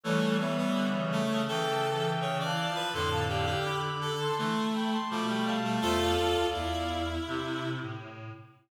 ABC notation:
X:1
M:4/4
L:1/16
Q:1/4=83
K:Flyd
V:1 name="Clarinet"
[A^c]2 [ce]6 (3[eg]4 [eg]4 [fa]4 | [ac'] [fa] [df]2 [bd']3 [ac']3 [gb] [ac'] [bd'] [gb] [fa]2 | [ce] [df]7 z8 |]
V:2 name="Clarinet"
A,2 B, B,2 z A,2 A4 ^c d2 B | A2 G G2 z A2 A,4 A, A,2 A, | [FA]4 E8 z4 |]
V:3 name="Clarinet"
E,2 z2 D, ^C,2 C, C,4 (3C,2 E,2 F,2 | D,8 E, z3 F, G, G,2 | A,2 z6 C,4 z4 |]
V:4 name="Clarinet" clef=bass
[E,G,]8 E,6 z2 | [F,,A,,]4 z8 B,,4 | E,,2 E,, D,, E,,4 C,3 A,,3 z2 |]